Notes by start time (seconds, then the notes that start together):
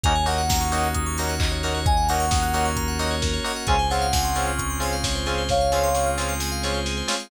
0.04 D#2 A#3 C#4 D#4 F#4 A#4 G#5, kick, closed hi-hat
0.15 C#5
0.26 A#3 C#4 D#4 F#4 D#5 F#5, open hi-hat
0.38 F#5
0.49 A#5, kick, snare
0.61 C#6
0.72 A#3 C#4 D#4 F#4 D#6, open hi-hat
0.83 F#6
0.95 D#6, kick, closed hi-hat
1.06 C#6
1.18 A#3 C#4 D#4 F#4 A#5, open hi-hat
1.29 F#5
1.40 D#5, kick, clap
1.52 C#5
1.63 A#3 C#4 D#4 F#4 A#4, open hi-hat
1.75 C#5
1.86 A#3 C#4 F#4 A#4 D#5 G#5, kick, closed hi-hat
1.97 F#5
2.08 A#3 C#4 D#4 F#4 F#5 A#5, open hi-hat
2.20 C#6
2.31 D#6, kick, snare
2.43 F#6
2.54 A#3 C#4 D#4 F#4 D#6, open hi-hat
2.65 C#6
2.77 A#5, kick, closed hi-hat
2.88 F#5
2.99 A#3 C#4 D#4 F#4 D#5, open hi-hat
3.11 C#5
3.22 A#4, kick, snare
3.34 C#5
3.44 A#3 C#4 D#4 F#4 D#5, open hi-hat
3.56 F#5
3.67 C#2 G#3 C4 C#4 F4 G#4 G#5, kick, closed hi-hat
3.79 C5
3.90 G#3 C4 C#4 F4 C#5 F#5, open hi-hat
4.02 F5
4.13 G#5, kick, snare
4.25 C6
4.35 G#3 C4 C#4 F4 C#6, open hi-hat
4.47 F6
4.59 C#6, kick, closed hi-hat
4.70 C6
4.80 G#3 C4 C#4 F4 G#5, open hi-hat
4.93 F5
5.04 C#5, kick, snare
5.15 C5
5.26 G#3 C4 C#4 F4 G#4, open hi-hat
5.38 C5
5.49 G#3 C4 F4 G#4 C#5 F5, kick, snare
5.61 F5
5.72 G#3 C4 C#4 F4 G#5, snare
5.84 C6
5.95 C#6, snare
6.06 F6
6.18 G#3 C4 C#4 F4 C#6, snare
6.29 C6
6.40 G#5, snare
6.52 F5
6.63 G#3 C4 C#4 F4 C#5, snare
6.74 C5
6.86 G#4, snare
6.97 C5
7.08 G#3 C4 C#4 F4 C#5, snare
7.20 F5